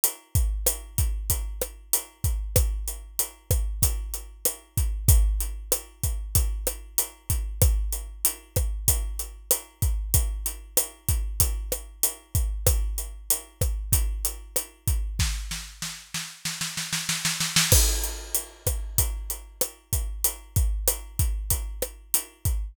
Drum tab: CC |----------------|----------------|----------------|----------------|
HH |x-x-x-x-x-x-x-x-|x-x-x-x-x-x-x-x-|x-x-x-x-x-x-x-x-|x-x-x-x-x-x-x-x-|
SD |----r-----r-----|r-----r-----r---|----r-----r-----|r-----r-----r---|
BD |--o---o-o-----o-|o-----o-o-----o-|o-----o-o-----o-|o-----o-o-----o-|

CC |----------------|----------------|----------------|x---------------|
HH |x-x-x-x-x-x-x-x-|x-x-x-x-x-x-x-x-|----------------|--x-x-x-x-x-x-x-|
SD |----r-----r-----|r-----r-----r---|o-o-o-o-oooooooo|r-----r-----r---|
BD |o-----o-o-----o-|o-----o-o-----o-|o---------------|o-----o-o-----o-|

CC |----------------|
HH |x-x-x-x-x-x-x-x-|
SD |----r-----r-----|
BD |--o---o-o-----o-|